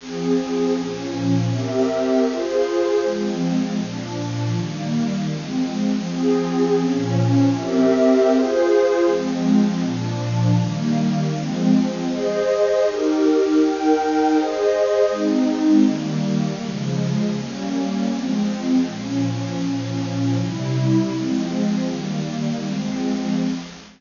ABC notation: X:1
M:2/4
L:1/8
Q:1/4=159
K:Fm
V:1 name="Pad 2 (warm)"
[F,CA]4 | [B,,F,D]4 | [CGB=e]4 | [FAc]4 |
[F,A,C]4 | [B,,F,=D]4 | [E,G,B,]4 | [F,A,C]4 |
[F,CA]4 | [B,,F,D]4 | [CGB=e]4 | [FAc]4 |
[F,A,C]4 | [B,,F,=D]4 | [E,G,B,]4 | [F,A,C]4 |
[K:Ab] [Ace]4 | [EGB]4 | [EBg]4 | [Ace]4 |
[A,CE]4 | [E,G,B,]4 | [D,F,A,]4 | [G,B,D]4 |
[K:Fm] [F,A,C]4 | [B,,F,D]4 | [B,,F,D]4 | [C,G,=E]4 |
[F,A,C]4 | [E,G,B,]4 | [F,A,C]4 |]